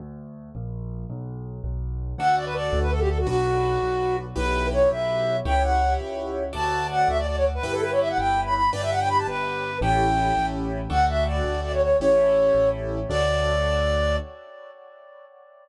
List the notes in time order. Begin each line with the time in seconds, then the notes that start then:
0.00 D2
0.55 A#1
1.10 B1
1.64 B1
2.18 D2 D4 F#4 A4 F#5
2.36 D5
2.45 B4
2.55 D5
2.73 D2
2.82 B4
2.91 A4
3.00 G4
3.09 A4
3.18 F#4
3.27 B1 D4 F#4 B4
3.83 B1
4.36 B1 E4 G4 B4
4.73 C#5
4.91 B1 E5
5.45 C#2 E4 G4 C#5 G5
5.63 F#5
6.00 C#2
6.53 D2 F#4 A4 D5 A5
6.91 F#5
7.08 D2 E5
7.18 D5
7.27 D5
7.36 C#5
7.55 B4
7.63 G1 E4 G4 B4
7.73 A4
7.82 B4
7.91 C#5
8.00 E5
8.09 F#5
8.18 G1 G5
8.45 B5
8.54 B5
8.73 G1 D4 G4 B4 D5
8.82 E5
8.91 F#5
9.00 G5
9.09 B5
9.18 A5
9.27 G1 B4
9.81 A1 C#4 E4 G4 A4 G5
10.37 A1
10.90 D2 D4 F#4 A4 F#5
11.09 E5
11.27 D5
11.44 D2
11.64 D5
11.73 C#5
11.82 C#5
12.00 A1 C#4 E4 G4 A4 C#5
12.55 A1
13.09 D2 D4 F#4 A4 D5